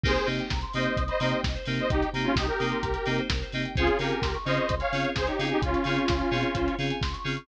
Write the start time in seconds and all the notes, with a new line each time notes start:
0.03 C2 A#3 C4 D#4 G4 G#4 A#4 C5, kick, crash
0.15 C5, closed hi-hat
0.26 C3 A#3 C4 D#4 G4 D#5, open hi-hat
0.39 G5, closed hi-hat
0.50 C2 A#5, kick, snare
0.61 C6, closed hi-hat
0.73 C3 A#3 C4 D#4 G4 C5 D#5 D#6, open hi-hat
0.85 G6, closed hi-hat
0.97 C2 D#6, kick, closed hi-hat
1.08 C5 D#5 B5, closed hi-hat
1.20 C3 A#3 C4 D#4 G4 A#5, open hi-hat
1.31 G5, closed hi-hat
1.43 C2 D#5, kick, snare
1.55 C5, closed hi-hat
1.66 C3 A#3 C4 D#4 G4 A#4, open hi-hat
1.78 C5 D#5, closed hi-hat
1.90 C2 D#4 G4 D#5, kick, closed hi-hat
2.01 G5, closed hi-hat
2.13 C3 A#3 C4 D#4 G4 A#5, open hi-hat
2.24 C#4 F4 C6, closed hi-hat
2.36 C2 D#4 G4 D#6, kick, snare
2.47 G4 A#4 G6, closed hi-hat
2.59 C3 A#3 C4 D#4 G4 D#6, open hi-hat
2.72 C6, closed hi-hat
2.83 C2 A#5, kick, closed hi-hat
2.94 G5, closed hi-hat
3.06 C3 A#3 C4 D#4 G4 D#5, open hi-hat
3.18 C5, closed hi-hat
3.30 C2 A#4, kick, snare
3.42 C5, closed hi-hat
3.52 C3 A#3 C4 D#4 G4 D#5, open hi-hat
3.65 G5, closed hi-hat
3.75 C#2 C4 C#4 F4 G#4 C5, kick, closed hi-hat
3.87 C#5, closed hi-hat
3.98 C#3 C4 C#4 F4 G4 G#4 A#4 F5, open hi-hat
4.11 G#5, closed hi-hat
4.22 C#2 C6, kick, snare
4.34 C#6, closed hi-hat
4.45 C#3 C4 C#4 F4 G#4 C5 D#5 F6, open hi-hat
4.57 C#6, closed hi-hat
4.68 C#2 C6, kick, closed hi-hat
4.80 C#5 F5 G#5, closed hi-hat
4.92 C#3 C4 C#4 F4 G#4 F5, open hi-hat
5.04 C#5, closed hi-hat
5.16 C#2 G#4 C5, kick, snare
5.27 D#4 G4 C#5, closed hi-hat
5.39 C#3 C4 C#4 F4 G#4 F5, open hi-hat
5.50 D#4 G4 G#5, closed hi-hat
5.62 C#2 C#4 F4 C6, kick, closed hi-hat
5.74 C#6, closed hi-hat
5.84 C#3 C4 C#4 F4 G#4 F6, open hi-hat
5.97 C#6, closed hi-hat
6.08 C#2 C6, kick, snare
6.19 G#5, closed hi-hat
6.31 B2 C4 C#4 F4 G#4 F5, open hi-hat
6.43 C#5, closed hi-hat
6.55 C#2 C5, kick, closed hi-hat
6.67 C#5, closed hi-hat
6.79 C#3 C4 C#4 F4 G#4 F5, open hi-hat
6.90 G#5, closed hi-hat
7.01 C#2 C6, kick, snare
7.13 C#6, closed hi-hat
7.24 C#3 C4 C#4 F4 G#4 F6, open hi-hat
7.36 C#6, closed hi-hat